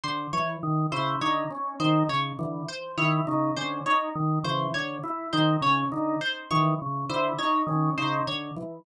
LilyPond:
<<
  \new Staff \with { instrumentName = "Drawbar Organ" } { \clef bass \time 5/4 \tempo 4 = 102 d8 r8 ees8 des8 d8 r8 ees8 des8 d8 r8 | ees8 des8 d8 r8 ees8 des8 d8 r8 ees8 des8 | d8 r8 ees8 des8 d8 r8 ees8 des8 d8 r8 | }
  \new Staff \with { instrumentName = "Drawbar Organ" } { \time 5/4 r8 e8 r8 e'8 ees'8 des'8 ees'8 r8 e8 r8 | e'8 ees'8 des'8 ees'8 r8 e8 r8 e'8 ees'8 des'8 | ees'8 r8 e8 r8 e'8 ees'8 des'8 ees'8 r8 e8 | }
  \new Staff \with { instrumentName = "Pizzicato Strings" } { \time 5/4 c''8 des''8 r8 c''8 des''8 r8 c''8 des''8 r8 c''8 | des''8 r8 c''8 des''8 r8 c''8 des''8 r8 c''8 des''8 | r8 c''8 des''8 r8 c''8 des''8 r8 c''8 des''8 r8 | }
>>